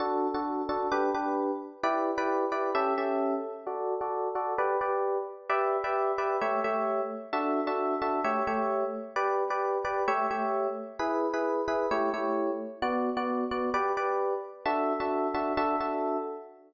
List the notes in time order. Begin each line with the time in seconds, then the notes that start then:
0.00 D4 F#4 A4
0.34 D4 F#4 A4
0.69 D4 F#4 A4
0.92 D4 G4 B4
1.14 D4 G4 B4
1.83 E4 G4 B4 D5
2.18 E4 G4 B4 D5
2.52 E4 G4 B4 D5
2.75 C#4 G4 A4 E5
2.98 C#4 G4 A4 E5
3.67 F#4 A4 D5
4.01 F#4 A4 D5
4.35 F#4 A4 D5
4.58 G4 B4 D5
4.81 G4 B4 D5
5.49 G4 B4 D5 E5
5.84 G4 B4 D5 E5
6.18 G4 B4 D5 E5
6.41 A3 G4 C#5 E5
6.64 A3 G4 C#5 E5
7.33 D4 F#4 A4 E5
7.67 D4 F#4 A4 E5
8.02 D4 F#4 A4 E5
8.24 A3 G4 C#5 E5
8.47 A3 G4 C#5 E5
9.16 G4 B4 D5
9.50 G4 B4 D5
9.85 G4 B4 D5
10.08 A3 G4 C#5 E5
10.31 A3 G4 C#5 E5
10.99 E4 G#4 B4
11.34 E4 G#4 B4
11.68 E4 G#4 B4
11.91 A3 E4 G4 C#5
12.14 A3 E4 G4 C#5
12.82 B3 F#4 D5
13.17 B3 F#4 D5
13.51 B3 F#4 D5
13.74 G4 B4 D5
13.97 G4 B4 D5
14.65 D4 F#4 A4 E5
15.00 D4 F#4 A4 E5
15.34 D4 F#4 A4 E5
15.57 D4 F#4 A4 E5
15.80 D4 F#4 A4 E5